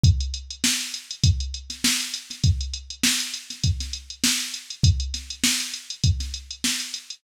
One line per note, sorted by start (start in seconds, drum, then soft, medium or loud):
0.04 kick loud
0.04 closed hi-hat loud
0.20 closed hi-hat medium
0.34 closed hi-hat medium
0.50 closed hi-hat medium
0.64 snare loud
0.81 closed hi-hat medium
0.94 closed hi-hat medium
1.11 closed hi-hat medium
1.24 kick loud
1.24 closed hi-hat loud
1.40 closed hi-hat medium
1.54 closed hi-hat medium
1.70 snare soft
1.70 closed hi-hat medium
1.84 snare loud
2.00 closed hi-hat medium
2.14 closed hi-hat medium
2.30 snare soft
2.30 closed hi-hat medium
2.44 kick loud
2.44 closed hi-hat loud
2.60 closed hi-hat medium
2.73 closed hi-hat medium
2.90 closed hi-hat medium
3.03 snare loud
3.20 closed hi-hat medium
3.34 closed hi-hat medium
3.50 snare soft
3.50 closed hi-hat medium
3.64 kick medium
3.64 closed hi-hat loud
3.80 snare soft
3.80 closed hi-hat medium
3.93 closed hi-hat medium
4.10 closed hi-hat medium
4.24 snare loud
4.40 closed hi-hat medium
4.54 closed hi-hat medium
4.70 closed hi-hat medium
4.83 kick loud
4.83 closed hi-hat loud
5.00 closed hi-hat medium
5.14 snare soft
5.14 closed hi-hat medium
5.30 closed hi-hat medium
5.44 snare loud
5.60 closed hi-hat medium
5.74 closed hi-hat medium
5.90 closed hi-hat medium
6.04 kick loud
6.04 closed hi-hat loud
6.20 snare soft
6.20 closed hi-hat medium
6.34 closed hi-hat medium
6.50 closed hi-hat medium
6.64 snare loud
6.80 closed hi-hat medium
6.94 closed hi-hat medium
7.10 closed hi-hat medium